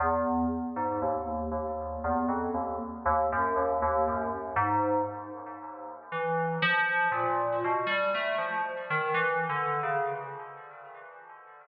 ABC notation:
X:1
M:5/8
L:1/16
Q:1/4=59
K:none
V:1 name="Electric Piano 2"
E,,2 z _A,, _E,,2 E,,2 =E,, F,, | _E,, z E,, _G,, E,, E,, G,, z _A,,2 | z4 E,2 F,2 _B,,2 | B,, G, A, F, z _E, (3=E,2 D,2 _D,2 |]